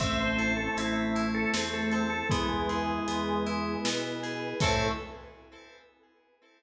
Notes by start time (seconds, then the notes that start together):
0.00 A1 A3 C4 C5 E5 A5, kick, crash
0.20 C5
0.38 E4 A4, closed hi-hat
0.57 A4
0.76 A1 C4 E4 A4, closed hi-hat
1.15 C4 E4 A4 C5 A5, closed hi-hat
1.34 A4
1.54 E2 C4 E4, snare
1.74 A4
1.92 C4 A4, closed hi-hat
2.10 A4
2.30 E2 G#3 B3 E4 B4 E5 G#5, kick, closed hi-hat
2.49 G#3
2.69 E4 G#4, closed hi-hat
3.08 E2 B3 G#4, closed hi-hat
3.46 B3 E4 B4 G#5 B5, closed hi-hat
3.85 B2 B3 E4, snare
4.23 G#4, closed hi-hat
4.60 A2 A3 C4 E4 A4 C5 E5 A5, kick, crash